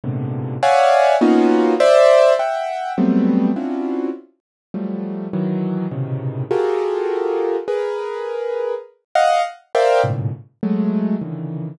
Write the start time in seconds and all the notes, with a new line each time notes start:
0.04 G#2 A2 A#2 B2 C3 D3
0.63 C#5 D5 E5 F5 F#5 G#5
1.21 A#3 B3 C#4 D#4 F4 F#4
1.80 C5 D5 E5
2.39 E5 F#5 G5
2.98 F#3 G3 A3 B3 C4
3.56 C4 C#4 D4 E4 F4 F#4
4.74 F3 F#3 G3 A3
5.33 D#3 E3 F#3
5.91 A2 B2 C3 C#3 D#3
6.51 F4 F#4 G4 G#4 A4 A#4
7.68 G#4 A#4 B4
9.15 D#5 F5 F#5
9.75 A#4 C5 D5 E5 F5 G5
10.03 F#2 G#2 A2 A#2 B2 C#3
10.63 F#3 G#3 A3
11.21 C#3 D3 D#3 E3